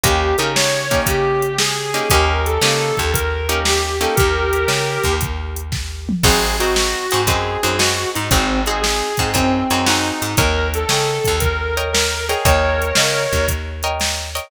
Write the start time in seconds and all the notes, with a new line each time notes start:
0.04 D#2 A#3 C#4 D#4 G4, kick, closed hi-hat
0.38 C#3 A#3 C#4 D#4 G4 A#4, closed hi-hat
0.55 C#5, snare
0.91 A#3 C#4 D#4 G4, kick, closed hi-hat
1.06 C#3 G4, kick, closed hi-hat
1.42 closed hi-hat
1.59 G#4, snare
1.94 A#3 C#4 D#4 G4, closed hi-hat
2.10 D#2 A#3 C#4 D#4 G4 A#4, kick, closed hi-hat
2.46 A4, closed hi-hat
2.61 C#3 A#3 C#4 D#4 G4, snare
2.97 D#2, kick, closed hi-hat
3.13 A#4, kick, closed hi-hat
3.49 A#3 C#4 D#4 G4, closed hi-hat
3.65 G4, snare
4.01 A#3 C#4 D#4 G4 A4, closed hi-hat
4.15 D#2 G4 A#4, kick, closed hi-hat
4.53 closed hi-hat
4.68 C#3, snare
5.04 D#2, kick, closed hi-hat
5.21 kick, closed hi-hat
5.56 closed hi-hat
5.72 kick, snare
6.09 mid tom
6.23 G#1 C4 D#4 F#4 G#4, kick, crash
6.60 C4 D#4 F#4 G#4, closed hi-hat
6.76 snare
7.11 G#2 C4 D#4 F#4 G#4, closed hi-hat
7.27 F#2 C4 D#4 F#4 G#4, kick, closed hi-hat
7.63 F#2 C4 D#4 F#4 G#4, closed hi-hat
7.78 C4 D#4 F#4 G#4, snare
8.15 G#2 D#4, closed hi-hat
8.30 G#1 C4 D#4 F#4 G#4, kick, closed hi-hat
8.66 C4 D#4 F#4 G#4, closed hi-hat
8.81 G#4, snare
9.17 G#2 C4 D#4 F#4 G#4, kick, closed hi-hat
9.34 F#2 C4 D#4 F#4 G#4, kick, closed hi-hat
9.70 F#2 C4 D#4 F#4 G#4, closed hi-hat
9.87 C4 D#4 F#4 G#4, snare
10.22 G#2, closed hi-hat
10.37 D#2 A#4 C#5 D#5 G5, kick, closed hi-hat
10.74 A4, closed hi-hat
10.89 C#3 A#4 C#5 D#5 G5, snare
11.25 D#2, kick, closed hi-hat
11.40 A#4, kick, closed hi-hat
11.77 A#4 C#5 D#5 G5, closed hi-hat
11.93 A#4, snare
12.28 G#4 A#4 C#5 D#5 G5, closed hi-hat
12.45 D#2 A#4 C#5 D#5 G5, kick, closed hi-hat
12.82 closed hi-hat
12.95 C#3 A#4 C#5 D#5 G5, snare
13.33 D#2, kick, closed hi-hat
13.48 kick, closed hi-hat
13.83 A#4 C#5 D#5 G5, closed hi-hat
14.00 snare, closed hi-hat
14.35 A#4 C#5 D#5 G5, closed hi-hat